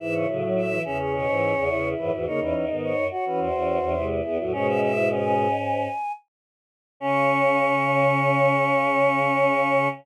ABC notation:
X:1
M:4/4
L:1/16
Q:1/4=106
K:C#m
V:1 name="Choir Aahs"
e c z2 e2 e c c6 B F | c B z2 c2 c B ^B6 G F | "^rit." c e e2 g8 z4 | c'16 |]
V:2 name="Choir Aahs"
E6 C6 E4 | D6 F6 E4 | "^rit." C3 E C C5 z6 | C16 |]
V:3 name="Choir Aahs"
[G,,E,]2 [A,,F,]4 [E,,C,]3 [G,,E,]2 [E,,C,] [E,,C,]2 [G,,E,] [G,,E,] | [C,^A,] [E,C]2 [D,B,]2 z2 [E,C]2 [E,C]2 [E,C] [^B,,G,]2 =B, [=A,,F,] | "^rit." [B,,G,]8 z8 | C16 |]
V:4 name="Choir Aahs" clef=bass
z C, C, F,2 E, z2 B,, G,,2 E,,3 F,, E,, | z E,, E,, G,,2 F,, z2 E,, E,,2 E,,3 E,, E,, | "^rit." G,,10 z6 | C,16 |]